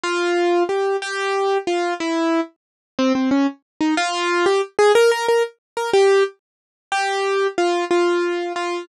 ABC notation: X:1
M:6/8
L:1/8
Q:3/8=122
K:F
V:1 name="Acoustic Grand Piano"
F4 G2 | G4 F2 | E3 z3 | [K:Fm] C C D z2 E |
F3 G z A | B B B z2 B | G2 z4 | [K:F] G4 F2 |
F4 F2 |]